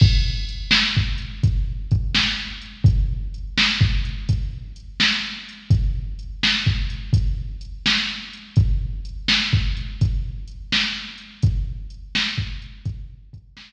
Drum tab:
CC |x-----------|------------|------------|------------|
HH |--x--xx-x--x|x-x--xx-x--x|x-x--xx-x--x|x-x--xx-x--x|
SD |---o-----o--|---o-----o--|---o-----o--|---o-----o--|
BD |o---o-o-o---|o---o-o-----|o---o-o-----|o---o-o-----|

CC |------------|
HH |x-x--xx-x---|
SD |---o-----o--|
BD |o---o-o-o---|